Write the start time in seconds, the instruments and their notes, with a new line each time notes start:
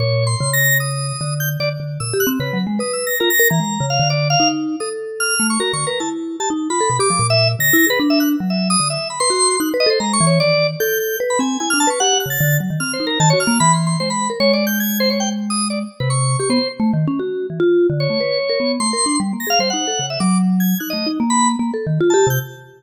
0.00 vibraphone A#2, drawbar organ C#5
0.27 drawbar organ C6
0.41 vibraphone C#3
0.53 drawbar organ A#6
0.80 drawbar organ D#6
1.21 vibraphone D3
1.40 drawbar organ G6
1.60 vibraphone D3, drawbar organ D5
1.80 vibraphone D3
2.00 vibraphone A#2, drawbar organ E6
2.14 vibraphone G4
2.20 drawbar organ F#6
2.27 vibraphone C4
2.40 vibraphone C#3, drawbar organ B4
2.53 vibraphone F#3
2.67 vibraphone G#3
2.79 vibraphone B4, drawbar organ D#6
2.93 drawbar organ E6
3.07 drawbar organ A#6
3.20 vibraphone F4, drawbar organ A#4
3.30 drawbar organ A#6
3.40 vibraphone A#4
3.50 vibraphone E3, drawbar organ A#5
3.60 vibraphone G#3
3.80 vibraphone C#3
3.90 drawbar organ F5
4.00 vibraphone D3
4.10 drawbar organ D5
4.30 drawbar organ F5
4.40 vibraphone D#4
4.80 vibraphone A4, drawbar organ D#6
5.20 drawbar organ F6
5.40 vibraphone A3
5.50 drawbar organ C#6
5.60 vibraphone F#4, drawbar organ A#4
5.73 vibraphone D3, drawbar organ C#6
5.87 drawbar organ A#4, vibraphone B4
6.00 vibraphone E4, drawbar organ A5
6.40 vibraphone G4, drawbar organ A5
6.50 vibraphone D#4
6.70 vibraphone F4, drawbar organ B5
6.81 vibraphone A4
6.90 vibraphone B2
6.99 vibraphone G4, drawbar organ D6
7.10 vibraphone F3
7.19 vibraphone A#2
7.30 drawbar organ E5
7.59 vibraphone D3, drawbar organ A#6
7.73 vibraphone E4
7.87 vibraphone G#4, drawbar organ B4
8.00 vibraphone D4
8.10 drawbar organ E5
8.20 drawbar organ F#6
8.40 vibraphone F#3
8.50 drawbar organ E5
8.70 drawbar organ D#6
8.80 vibraphone D3
8.90 drawbar organ E5
9.10 drawbar organ B5
9.20 vibraphone B4, drawbar organ C6
9.30 vibraphone F#4
9.60 vibraphone D#4, drawbar organ F#6
9.74 vibraphone B4
9.80 drawbar organ D#5
9.86 vibraphone A4, drawbar organ C5
10.00 vibraphone G#3, drawbar organ A#5
10.13 drawbar organ C#6
10.21 vibraphone E3
10.27 drawbar organ C#5
10.40 vibraphone D#3, drawbar organ D5
10.80 vibraphone A4, drawbar organ G6
11.00 drawbar organ G6
11.20 vibraphone B4
11.30 drawbar organ B5
11.39 vibraphone C4, drawbar organ G#5
11.60 vibraphone E4, drawbar organ G#5
11.70 vibraphone D4, drawbar organ F6
11.80 drawbar organ A5
11.87 vibraphone B4, drawbar organ C#6
12.00 vibraphone G4, drawbar organ F#5
12.13 vibraphone G4
12.20 drawbar organ F#6
12.26 vibraphone C#3
12.30 drawbar organ A6
12.41 vibraphone D3
12.60 vibraphone F#3
12.70 vibraphone D#3
12.80 vibraphone C4, drawbar organ F6
12.93 drawbar organ C5
13.00 vibraphone D#4
13.07 drawbar organ A#4
13.20 vibraphone D#3, drawbar organ A5
13.30 vibraphone F#4, drawbar organ C#5
13.40 drawbar organ F6
13.47 vibraphone A#3
13.60 vibraphone E3, drawbar organ B5
13.73 drawbar organ C6
13.87 drawbar organ C6
14.00 vibraphone G#3, drawbar organ C5
14.10 drawbar organ B5
14.30 vibraphone A#4
14.40 vibraphone G#3, drawbar organ C#5
14.53 drawbar organ D5
14.67 drawbar organ G6
14.80 drawbar organ G#6
15.00 drawbar organ C5
15.10 drawbar organ C#5
15.20 drawbar organ G5
15.50 drawbar organ D#6
15.70 drawbar organ D5
16.00 vibraphone C3, drawbar organ B4
16.10 drawbar organ C#6
16.39 vibraphone G4, drawbar organ C#6
16.50 vibraphone B3, drawbar organ C5
16.80 vibraphone A3
16.93 vibraphone D#3
17.08 vibraphone C#4
17.20 vibraphone F#4
17.50 vibraphone E3
17.60 vibraphone F4
17.90 vibraphone D3
18.00 drawbar organ C#5
18.10 vibraphone A3
18.20 vibraphone B4
18.50 vibraphone A#4
18.60 vibraphone B3
18.80 vibraphone A3, drawbar organ C6
18.93 vibraphone A#4
19.06 vibraphone D4
19.20 vibraphone G3
19.33 vibraphone A#3
19.40 drawbar organ A#6
19.47 vibraphone G#4, drawbar organ F5
19.59 vibraphone G3, drawbar organ C5
19.70 vibraphone D#4, drawbar organ F#5
19.88 vibraphone A4
19.99 vibraphone C#3
20.10 drawbar organ E5
20.20 vibraphone F#3, drawbar organ D6
20.60 drawbar organ G#6
20.80 vibraphone D#4, drawbar organ F#6
20.90 vibraphone A3, drawbar organ D#5
21.06 vibraphone D#4
21.20 vibraphone A#3
21.30 drawbar organ B5
21.59 vibraphone A#3
21.74 vibraphone A4
21.87 vibraphone D#3
22.01 vibraphone F4
22.10 vibraphone G4, drawbar organ A5
22.27 vibraphone C3, drawbar organ G6